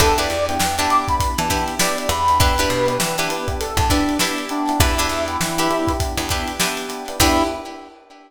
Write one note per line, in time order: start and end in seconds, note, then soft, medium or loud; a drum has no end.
0.00 0.28 E2 loud
0.00 0.37 B3 loud
0.00 0.14 D4 medium
0.00 0.37 D4 loud
0.00 0.14 E4 medium
0.00 0.37 E4 loud
0.00 0.37 G4 loud
0.00 0.14 G4 medium
0.00 0.17 A4 medium
0.00 0.14 B4 medium
0.00 kick loud
0.00 closed hi-hat loud
0.18 0.63 D4 medium
0.18 0.63 E4 medium
0.18 0.63 G4 medium
0.18 0.63 B4 medium
0.18 0.45 D5 medium
0.18 closed hi-hat medium
0.30 0.58 E2 medium
0.30 closed hi-hat medium
0.48 0.58 B3 medium
0.48 0.58 D4 medium
0.48 0.58 E4 loud
0.48 0.58 G4 medium
0.48 0.76 G5 medium
0.48 closed hi-hat medium
0.59 0.87 E2 medium
0.59 0.75 B3 loud
0.59 0.75 D4 medium
0.59 0.75 E4 medium
0.59 0.75 G4 medium
0.59 snare loud
0.78 0.88 B3 medium
0.78 0.88 D4 medium
0.78 1.24 D4 medium
0.78 0.88 E4 loud
0.78 1.24 E4 medium
0.78 0.88 G4 loud
0.78 1.24 G4 medium
0.78 1.24 B4 medium
0.78 0.89 A5 medium
0.78 snare soft
0.78 closed hi-hat medium
0.90 1.05 B3 loud
0.90 1.05 D4 medium
0.90 1.05 E4 medium
0.90 1.05 G4 medium
0.90 1.07 D6 medium
0.90 closed hi-hat medium
1.08 1.31 B3 loud
1.08 1.31 D4 medium
1.08 1.31 E4 medium
1.08 1.31 G4 medium
1.08 1.38 B5 medium
1.08 kick medium
1.08 closed hi-hat medium
1.20 kick loud
1.20 closed hi-hat loud
1.38 1.65 E3 medium
1.38 1.74 B3 medium
1.38 1.74 D4 medium
1.38 1.74 E4 medium
1.38 1.74 G4 loud
1.38 1.65 A5 medium
1.38 snare soft
1.38 closed hi-hat medium
1.50 1.75 D4 medium
1.50 1.75 E4 medium
1.50 1.75 G4 medium
1.50 1.75 B4 medium
1.50 kick medium
1.50 closed hi-hat medium
1.68 closed hi-hat medium
1.79 2.06 B3 medium
1.79 2.30 D4 medium
1.79 2.06 D4 medium
1.79 2.30 E4 medium
1.79 2.06 E4 medium
1.79 2.30 G4 medium
1.79 2.06 G4 medium
1.79 2.30 B4 medium
1.79 1.97 D5 medium
1.79 snare loud
1.98 2.09 D5 medium
1.98 closed hi-hat medium
2.09 2.67 E2 loud
2.09 2.23 B3 medium
2.09 2.23 D4 medium
2.09 2.23 E4 medium
2.09 2.23 G4 loud
2.09 2.38 B5 medium
2.09 closed hi-hat medium
2.28 2.39 B3 medium
2.28 2.39 D4 loud
2.28 2.39 E4 medium
2.28 2.39 G4 medium
2.28 snare soft
2.28 closed hi-hat medium
2.40 2.77 B3 loud
2.40 2.77 D4 loud
2.40 2.54 D4 medium
2.40 2.77 E4 loud
2.40 2.54 E4 medium
2.40 2.77 G4 loud
2.40 2.54 G4 medium
2.40 3.16 B4 medium
2.40 2.54 B4 loud
2.40 kick loud
2.40 closed hi-hat loud
2.58 3.04 D4 medium
2.58 3.04 E4 medium
2.58 3.04 G4 medium
2.58 3.04 B4 medium
2.58 closed hi-hat medium
2.70 2.98 B2 medium
2.70 closed hi-hat medium
2.87 2.97 B3 medium
2.87 2.97 D4 medium
2.87 2.97 E4 medium
2.87 2.97 G4 medium
2.87 closed hi-hat medium
2.98 3.28 E3 medium
2.98 3.13 B3 medium
2.98 3.13 D4 medium
2.98 3.13 E4 medium
2.98 3.13 G4 medium
2.98 snare loud
3.18 3.28 B3 medium
3.18 3.64 D4 medium
3.18 3.28 D4 loud
3.18 3.28 E4 medium
3.18 3.64 E4 medium
3.18 3.28 G4 medium
3.18 3.64 G4 medium
3.18 3.64 B4 medium
3.18 closed hi-hat medium
3.28 3.43 B3 medium
3.28 3.43 D4 medium
3.28 3.43 E4 medium
3.28 3.43 G4 loud
3.28 3.47 B4 medium
3.28 closed hi-hat loud
3.48 3.70 B3 medium
3.48 3.70 D4 medium
3.48 3.70 E4 medium
3.48 3.70 G4 medium
3.48 kick medium
3.48 closed hi-hat medium
3.60 3.77 A4 medium
3.60 closed hi-hat loud
3.77 4.03 E2 medium
3.77 4.13 B3 medium
3.77 4.13 D4 medium
3.77 4.13 E4 medium
3.77 4.13 G4 medium
3.77 3.90 A4 medium
3.77 kick loud
3.77 closed hi-hat medium
3.90 4.15 D4 medium
3.90 4.18 D4 medium
3.90 4.15 E4 medium
3.90 4.15 G4 medium
3.90 4.15 B4 medium
3.90 kick loud
3.90 snare soft
3.90 closed hi-hat loud
4.09 closed hi-hat medium
4.19 4.46 B3 loud
4.19 4.71 D4 medium
4.19 4.46 D4 medium
4.19 4.46 E4 medium
4.19 4.71 E4 medium
4.19 4.46 G4 medium
4.19 4.71 G4 medium
4.19 4.71 B4 medium
4.19 snare loud
4.38 closed hi-hat medium
4.49 4.65 B3 medium
4.49 4.78 D4 medium
4.49 4.65 D4 medium
4.49 4.65 E4 medium
4.49 4.65 G4 medium
4.49 closed hi-hat medium
4.67 4.78 B3 medium
4.67 4.78 D4 medium
4.67 4.78 E4 medium
4.67 4.78 G4 medium
4.67 snare soft
4.67 closed hi-hat medium
4.80 5.08 E2 loud
4.80 5.17 B3 loud
4.80 4.95 D4 medium
4.80 5.17 D4 loud
4.80 5.92 E4 medium
4.80 5.17 E4 loud
4.80 4.95 E4 medium
4.80 5.17 G4 loud
4.80 4.95 G4 medium
4.80 4.95 B4 medium
4.80 kick loud
4.80 closed hi-hat loud
4.98 5.44 D4 medium
4.98 5.44 E4 medium
4.98 5.44 G4 medium
4.98 5.44 B4 medium
4.98 closed hi-hat medium
5.09 5.37 E2 medium
5.09 closed hi-hat medium
5.28 5.38 B3 medium
5.28 5.38 D4 medium
5.28 5.38 E4 medium
5.28 5.38 G4 medium
5.28 closed hi-hat medium
5.41 5.68 E3 medium
5.41 5.55 B3 medium
5.41 5.55 D4 medium
5.41 5.55 E4 medium
5.41 5.55 G4 loud
5.41 snare loud
5.58 5.67 B3 loud
5.58 5.67 D4 medium
5.58 6.04 D4 medium
5.58 5.67 E4 medium
5.58 6.04 E4 medium
5.58 5.67 G4 medium
5.58 6.04 G4 medium
5.58 6.04 B4 medium
5.58 snare soft
5.58 closed hi-hat medium
5.70 5.85 B3 medium
5.70 5.85 D4 loud
5.70 5.85 E4 medium
5.70 5.85 G4 medium
5.70 closed hi-hat medium
5.87 6.12 B3 medium
5.87 6.12 D4 medium
5.87 6.12 E4 loud
5.87 6.12 G4 loud
5.87 kick medium
5.87 snare soft
5.87 closed hi-hat medium
6.00 kick loud
6.00 closed hi-hat loud
6.17 6.44 E2 medium
6.17 6.53 B3 medium
6.17 6.53 D4 medium
6.17 6.53 E4 loud
6.17 6.53 G4 medium
6.17 closed hi-hat medium
6.29 6.56 D4 medium
6.29 6.56 E4 medium
6.29 6.56 G4 medium
6.29 6.56 B4 medium
6.29 kick medium
6.29 closed hi-hat medium
6.48 closed hi-hat medium
6.60 6.85 B3 medium
6.60 6.85 D4 medium
6.60 7.10 D4 medium
6.60 6.85 E4 medium
6.60 7.10 E4 medium
6.60 6.85 G4 medium
6.60 7.10 G4 medium
6.60 7.10 B4 medium
6.60 snare loud
6.77 snare medium
6.77 closed hi-hat medium
6.89 7.03 B3 medium
6.89 7.03 D4 medium
6.89 7.03 E4 medium
6.89 7.03 G4 medium
6.89 snare soft
6.89 closed hi-hat medium
7.08 7.18 B3 medium
7.08 7.18 D4 loud
7.08 7.18 E4 medium
7.08 7.18 G4 medium
7.08 closed hi-hat medium
7.20 7.43 E2 loud
7.20 7.44 B3 loud
7.20 7.43 D4 loud
7.20 7.44 D4 loud
7.20 7.43 E4 loud
7.20 7.44 E4 loud
7.20 7.43 G4 loud
7.20 7.44 G4 loud
7.20 7.43 B4 loud
7.20 kick loud
7.20 crash loud